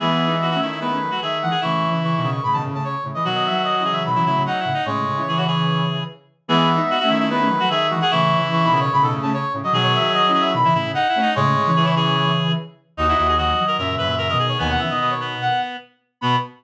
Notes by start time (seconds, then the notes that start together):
0.00 E3 G#3 B3 G#4 E5
0.27 B3 D#4
0.42 F#4
0.51 A3 C#4 F#4
0.61 D#3 E4
0.71 E4
0.80 G#3 B3 E4 B4
0.91 A3 C#4
1.02 F#3 A3
1.11 F#3 A3 F#4
1.22 D#3 G#4 E5
1.42 E3 G#3 F#5
1.51 G#4 F#5
1.61 A2 C#3 E3 E4 C#6
1.90 C#3 E3
2.02 E3 C#6
2.16 B2 D#3 C#6
2.22 C#3
2.30 C#6
2.43 A2 C#3 B5
2.53 B2 D#3 A5
2.65 A2 C#3
2.74 A2 C#3 A5
2.84 C#5
3.03 A2 C#3
3.14 E3 D#5
3.24 B2 D#3 F#3 F#4
3.34 D#5
3.45 E5
3.50 D#3 F#3
3.64 D#5
3.78 C#3 E3 D#5
3.85 G#4
3.91 E5
4.06 B2 D#3 B5
4.15 C#3 E3 E4
4.26 A2 C#3 E4
4.37 A2 C#3
4.46 D#4 F#5
4.60 E4
4.65 A2 C#3
4.74 D#4
4.85 A2 C#3 G#3 C#5
5.06 A2 C#3
5.16 C#3 E3
5.28 E3 G#4
5.37 F#4
5.47 G#4 C#5
6.48 E3 G#3 B3 G#4 E5
6.75 B3 D#4
6.90 F#4
6.99 A3 C#4 F#4
7.09 D#3 E4
7.20 E4
7.29 G#3 B3 E4 B4
7.40 A3 C#4
7.49 F#3 A3
7.60 F#3 A3 F#4
7.69 D#3 G#4 E5
7.90 E3 G#3 F#4
8.00 G#4 F#5
8.11 A2 C#3 E3 E4 C#6
8.37 C#3 E3
8.52 E3 C#6
8.64 B2 D#3 B5
8.71 C#3
8.80 C#5
8.91 A2 C#3 B5
9.01 B2 D#3 A4
9.11 A2 C#3
9.22 A3 C#4 A5
9.33 C#5
9.53 A2 C#3
9.63 F#3 D#5
9.72 B2 D#3 F#3 G#4
9.83 C#5
9.94 E5
10.00 D#3 F#3
10.13 D#5
10.27 C#4 E4 D#5
10.33 G#4
10.40 E5
10.54 B2 D#3 B5
10.63 C#3 E3 E4
10.74 A2 C#3 E4
10.85 A2 C#3
10.94 D#4 F#5
11.09 E4
11.15 A3 C#4
11.22 D#4
11.35 A2 C#3 G#3 C#5
11.56 A2 C#3
11.66 C#3 E3
11.76 E3 G#4
11.85 E4
11.96 G#4 C#5
12.97 D#2 D#4 F#4 D#5
13.07 D#4 E4 F#4
13.18 D#2 E4
13.28 G#4
13.37 D#3 F#3 F#4 D#5
13.58 D#3 F#3
13.67 A#4
13.78 F#2 A#2 C#3 A#4 E5
13.89 E5
13.98 F#2 B4 E5
14.05 A#2 C#3 E5
14.18 A#4 E5
14.28 B2 D#3 A#4 D#5
14.39 G#4
14.48 C#5
14.58 D#2 B2 D#3 B3 G#5
14.69 F#5
14.79 C#3 E3 E5
14.90 B2 D#3 D#5
15.00 B2 D#5
15.10 C#5
15.20 B3
15.41 F#5
16.21 B2 B3 B5